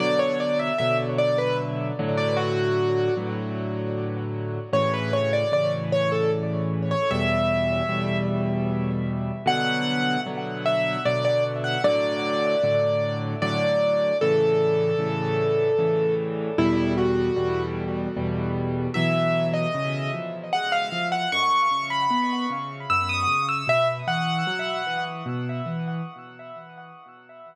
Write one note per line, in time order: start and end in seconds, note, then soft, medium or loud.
0.00 0.71 B2 medium
0.00 0.71 D3 loud
0.00 0.71 F#3 loud
0.00 0.19 D5 loud
0.19 0.38 C#5 loud
0.40 0.59 D5 medium
0.59 0.78 E5 medium
0.78 1.92 B2 medium
0.78 1.92 D3 medium
0.78 1.92 F#3 medium
0.78 0.97 E5 loud
1.18 1.37 D5 loud
1.38 1.57 B4 loud
1.99 3.10 A2 loud
1.99 3.10 D3 loud
1.99 3.10 F#3 loud
2.17 2.36 D5 medium
2.37 3.14 F#4 loud
3.17 4.59 A2 medium
3.17 4.59 D3 medium
3.17 4.59 F#3 medium
4.73 5.44 A2 loud
4.73 5.44 C#3 medium
4.73 5.44 E3 loud
4.73 4.92 C#5 loud
4.94 5.12 B4 medium
5.13 5.32 C#5 medium
5.33 5.52 D5 medium
5.52 6.94 A2 medium
5.52 6.94 C#3 medium
5.52 6.94 E3 medium
5.52 5.72 D5 medium
5.92 6.11 C#5 loud
6.12 6.31 A4 medium
6.91 7.10 C#5 medium
7.11 7.82 E2 loud
7.11 7.82 B2 medium
7.11 7.82 G3 medium
7.11 8.17 E5 loud
7.88 9.31 E2 medium
7.88 9.31 B2 medium
7.88 9.31 G3 medium
9.46 10.17 B2 loud
9.46 10.17 D3 loud
9.46 10.17 F#3 loud
9.46 10.20 F#5 loud
10.26 10.97 B2 medium
10.26 10.97 D3 medium
10.26 10.97 F#3 medium
10.66 11.00 E5 loud
11.05 11.77 B2 medium
11.05 11.77 D3 medium
11.05 11.77 F#3 medium
11.05 11.24 D5 loud
11.25 11.43 D5 loud
11.64 11.83 F#5 medium
11.84 12.55 A2 loud
11.84 12.55 D3 loud
11.84 12.55 F#3 loud
11.84 13.18 D5 loud
12.63 13.35 A2 medium
12.63 13.35 D3 loud
12.63 13.35 F#3 medium
13.42 14.13 A2 medium
13.42 14.13 D3 loud
13.42 14.13 F#3 medium
13.42 14.17 D5 loud
14.21 14.93 A2 loud
14.21 14.93 C#3 loud
14.21 14.93 E3 loud
14.21 16.14 A4 loud
14.99 15.70 A2 medium
14.99 15.70 C#3 medium
14.99 15.70 E3 loud
15.79 16.50 A2 medium
15.79 16.50 C#3 medium
15.79 16.50 E3 loud
16.58 17.29 E2 loud
16.58 17.29 B2 loud
16.58 17.29 G3 loud
16.58 16.93 E4 loud
16.98 17.63 F#4 medium
17.36 18.07 E2 medium
17.36 18.07 B2 medium
17.36 18.07 G3 medium
18.16 18.88 E2 medium
18.16 18.88 B2 medium
18.16 18.88 G3 medium
18.94 19.66 B2 medium
18.94 19.66 E3 loud
18.94 19.66 F#3 medium
18.94 19.47 E5 loud
19.54 20.11 D#5 medium
19.75 20.10 C#3 medium
20.14 20.49 F3 medium
20.53 20.90 G#3 medium
20.53 20.72 F#5 loud
20.72 21.07 F5 loud
20.92 21.28 F3 medium
21.12 21.31 F#5 medium
21.32 21.68 F#2 loud
21.32 21.86 C#6 loud
21.71 22.07 C#3 medium
21.90 22.44 B5 medium
22.11 22.46 B3 medium
22.50 22.86 C#3 medium
22.90 23.25 F#2 medium
22.90 23.09 E6 medium
23.09 23.46 D#6 loud
23.27 23.63 C#3 medium
23.49 23.67 E6 medium
23.67 24.03 B2 medium
23.67 23.88 E5 loud
24.07 24.43 E3 medium
24.07 25.04 F#5 loud
24.47 24.82 F#3 medium
24.87 25.22 E3 medium
25.26 25.61 B2 medium
25.66 26.01 E3 medium